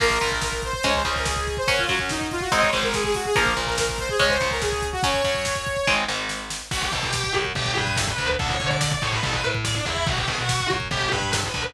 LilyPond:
<<
  \new Staff \with { instrumentName = "Lead 2 (sawtooth)" } { \time 4/4 \key bes \minor \tempo 4 = 143 bes'8. bes'16 bes'8 c''16 c''16 des''16 c''8 bes'16 aes'8. c''16 | des''16 f'16 ges'16 des'16 ees'8 f'16 ges'16 ees''16 des''16 c''16 bes'16 aes'16 aes'16 ges'16 aes'16 | bes'8. bes'16 bes'8 c''16 aes'16 des''16 c''8 bes'16 aes'8. ges'16 | des''2~ des''8 r4. |
\key b \minor r1 | r1 | r1 | }
  \new Staff \with { instrumentName = "Distortion Guitar" } { \time 4/4 \key bes \minor r1 | r1 | r1 | r1 |
\key b \minor fis'16 g'16 a'16 g'8. r8 g'8 b'8 a'16 b'8 r16 | a'16 cis''8 d''16 d''16 d''16 cis''16 b'16 a'16 b'16 r8 d''16 d'16 e'8 | fis'16 g'16 gis'16 fis'8. r8 g'8 b'8 a'16 b'8 r16 | }
  \new Staff \with { instrumentName = "Overdriven Guitar" } { \time 4/4 \key bes \minor <f bes>8 bes,4. <aes des'>8 des4. | <ges des'>8 ges4. <aes c' ees'>8 aes,4. | <f bes>8 bes,4. <aes des'>8 des4. | <ges des'>8 ges4. <aes c' ees'>8 aes,4. |
\key b \minor r1 | r1 | r1 | }
  \new Staff \with { instrumentName = "Electric Bass (finger)" } { \clef bass \time 4/4 \key bes \minor bes,,8 bes,,4. des,8 des,4. | ges,8 ges,4. aes,,8 aes,,4. | bes,,8 bes,,4. des,8 des,4. | ges,8 ges,4. aes,,8 aes,,4. |
\key b \minor b,,8 b,4 fis,8 g,,8 g,4 d,8 | d,8 d4 a,8 a,,8 a,4 e,8 | b,,8 b,4 fis,8 g,,8 g,4 d,8 | }
  \new DrumStaff \with { instrumentName = "Drums" } \drummode { \time 4/4 <cymc bd>16 bd16 <hh bd>16 bd16 <bd sn>16 bd16 <hh bd>16 bd16 <hh bd>16 bd16 <hh bd>16 bd16 <bd sn>16 bd16 <hh bd>16 bd16 | <hh bd>16 bd16 <hh bd>16 bd16 <bd sn>16 bd16 <hh bd>16 bd16 <hh bd>16 bd16 <hh bd>16 bd16 <bd sn>16 bd16 <hho bd>16 bd16 | <hh bd>16 bd16 <hh bd>16 bd16 <bd sn>16 bd16 <hh bd>16 bd16 <hh bd>16 bd16 <hh bd>16 bd16 <bd sn>16 bd16 <hh bd>16 bd16 | <hh bd>16 bd16 <hh bd>16 bd16 <bd sn>16 bd16 <hh bd>16 bd16 <bd sn>8 sn8 sn8 sn8 |
<cymc bd>16 bd16 <bd tomfh>16 bd16 <bd sn>16 bd16 <bd tomfh>16 bd16 <bd tomfh>16 bd16 <bd tomfh>16 bd16 <bd sn>16 bd16 <bd tomfh>16 bd16 | <bd tomfh>16 bd16 <bd tomfh>16 bd16 <bd sn>16 bd16 <bd tomfh>16 bd16 <bd tomfh>16 bd16 <bd tomfh>16 bd16 <bd sn>16 bd16 <bd tomfh>16 bd16 | <bd tomfh>16 bd16 <bd tomfh>16 bd16 <bd sn>16 bd16 <bd tomfh>16 bd16 <bd tomfh>16 bd16 <bd tomfh>16 bd16 <bd sn>16 bd16 <bd tomfh>16 bd16 | }
>>